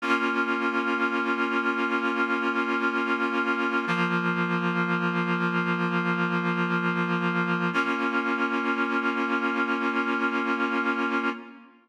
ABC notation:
X:1
M:4/4
L:1/8
Q:1/4=62
K:Bbdor
V:1 name="Clarinet"
[B,DF]8 | [F,B,F]8 | [B,DF]8 |]